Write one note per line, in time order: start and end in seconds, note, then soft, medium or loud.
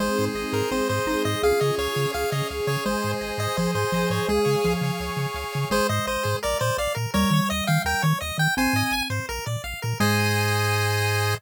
0.00 0.09 G#1 medium
0.00 0.63 G#3 medium
0.00 0.71 C4 medium
0.00 0.71 D#4 medium
0.00 0.71 G#4 medium
0.00 0.25 C5 medium
0.18 0.29 G#2 medium
0.18 0.52 C5 medium
0.35 0.44 G#1 medium
0.35 1.08 D#5 medium
0.52 0.62 G#2 medium
0.52 0.70 A#4 medium
0.52 0.89 C5 medium
0.71 0.81 G#1 medium
0.71 1.43 G#3 medium
0.71 0.88 C4 medium
0.71 1.43 C4 medium
0.71 1.39 G#4 medium
0.71 1.42 G#4 medium
0.71 0.88 C5 medium
0.89 0.99 G#2 medium
0.89 1.23 C5 medium
0.89 1.25 C5 medium
1.06 1.15 G#1 medium
1.06 1.40 D#4 medium
1.06 1.42 D#5 medium
1.25 1.35 G#2 medium
1.25 1.42 C5 medium
1.25 1.42 D#5 medium
1.43 1.53 C#2 medium
1.43 2.13 C#4 medium
1.43 2.14 F4 medium
1.43 2.13 G#4 medium
1.43 2.06 G#4 medium
1.43 2.12 G#4 medium
1.43 1.60 F5 medium
1.60 1.71 C#3 medium
1.60 1.94 C#5 medium
1.60 1.75 D#5 medium
1.78 1.88 C#2 medium
1.78 2.11 C#5 medium
1.78 2.50 F5 medium
1.95 2.06 C#3 medium
1.95 2.31 C#5 medium
2.13 2.24 C#2 medium
2.13 2.84 C#4 medium
2.13 2.67 G#4 medium
2.13 2.84 G#4 medium
2.13 2.84 C#5 medium
2.13 2.30 F5 medium
2.31 2.42 C#3 medium
2.31 2.82 C#5 medium
2.31 2.48 D#5 medium
2.50 2.60 C#2 medium
2.50 2.85 F5 medium
2.67 2.77 C#3 medium
2.67 3.57 G#4 medium
2.67 2.84 C#5 medium
2.85 2.95 G#1 medium
2.85 3.49 G#3 medium
2.85 3.56 C5 medium
2.85 3.12 C5 medium
2.85 3.56 D#5 medium
2.85 3.56 G#5 medium
3.02 3.14 G#2 medium
3.02 3.38 C5 medium
3.21 3.31 G#1 medium
3.21 3.93 D#5 medium
3.38 3.48 G#2 medium
3.38 3.75 C5 medium
3.38 3.56 D#5 medium
3.57 3.67 G#1 medium
3.57 3.74 F3 medium
3.57 4.25 G#4 medium
3.57 4.28 G#4 medium
3.57 3.71 C5 medium
3.57 4.28 C5 medium
3.57 4.28 G#5 medium
3.75 3.85 G#2 medium
3.75 4.09 C5 medium
3.75 4.11 C5 medium
3.92 4.04 G#1 medium
3.92 4.23 F3 medium
3.92 4.28 D#5 medium
4.10 4.20 G#2 medium
4.10 4.29 C5 medium
4.10 4.27 C#5 medium
4.29 4.39 C#2 medium
4.29 4.59 G#3 medium
4.29 4.73 G#4 medium
4.29 5.00 G#4 medium
4.29 5.00 C#5 medium
4.29 5.00 F5 medium
4.29 5.00 G#5 medium
4.45 4.56 C#3 medium
4.45 4.83 C#5 medium
4.64 4.75 C#2 medium
4.64 5.24 F3 medium
4.64 5.35 F5 medium
4.81 4.91 C#3 medium
4.81 5.18 C#5 medium
5.00 5.10 C#2 medium
5.00 5.69 G#4 medium
5.00 5.71 C#5 medium
5.00 5.71 G#5 medium
5.00 5.71 C#6 medium
5.17 5.26 C#3 medium
5.17 5.52 C#5 medium
5.34 5.44 C#2 medium
5.34 5.69 F5 medium
5.52 5.65 C#3 medium
5.52 5.69 C#5 medium
5.70 5.80 G#1 loud
5.70 7.06 G#3 medium
5.70 5.87 G#4 loud
5.70 5.87 C5 loud
5.89 5.99 G#2 loud
5.89 6.06 C5 medium
5.89 6.06 D#5 loud
6.07 6.17 G#1 loud
6.07 6.37 C5 medium
6.07 6.23 D#5 medium
6.23 6.35 G#2 medium
6.23 6.39 G#4 medium
6.43 6.54 A#1 loud
6.43 6.59 A#4 loud
6.43 6.58 D5 loud
6.59 6.71 A#2 medium
6.59 6.77 C5 loud
6.59 6.75 D5 medium
6.78 6.87 A#1 loud
6.78 6.93 D5 medium
6.78 6.95 F5 medium
6.95 7.06 A#2 medium
6.95 7.11 A#4 loud
7.14 7.25 D#2 loud
7.14 8.49 G3 medium
7.14 7.30 A#4 loud
7.14 7.49 C#5 loud
7.31 7.40 D#3 loud
7.31 7.49 C#5 medium
7.50 7.61 D#2 medium
7.50 7.64 D#5 loud
7.50 7.66 D#5 loud
7.67 7.78 D#3 loud
7.67 7.82 F5 loud
7.67 7.83 G5 medium
7.85 7.94 D#2 loud
7.85 8.02 A#4 loud
7.85 8.03 G5 loud
8.02 8.13 D#3 loud
8.02 8.18 C#5 loud
8.02 8.19 C#5 medium
8.21 8.32 D#2 medium
8.21 8.37 D#5 medium
8.38 8.48 D#3 medium
8.38 8.55 G5 medium
8.38 8.55 G5 loud
8.57 8.67 G#1 loud
8.57 9.24 C4 medium
8.57 8.74 C5 loud
8.57 9.03 G#5 loud
8.73 8.83 G#2 loud
8.73 8.92 D#5 medium
8.91 9.01 G#1 loud
8.91 9.08 G#5 loud
9.10 9.20 G#2 medium
9.10 9.26 C5 loud
9.29 9.39 A#1 loud
9.29 9.45 A#4 loud
9.46 9.57 A#2 medium
9.46 9.62 D5 medium
9.64 9.74 A#1 loud
9.64 9.80 F5 medium
9.82 9.94 A#2 loud
9.82 9.98 A#4 loud
10.00 11.35 G#2 loud
10.00 11.34 G#3 loud
10.00 11.35 G#4 loud
10.00 11.35 C5 loud
10.00 11.35 D#5 loud
10.00 11.34 G#5 loud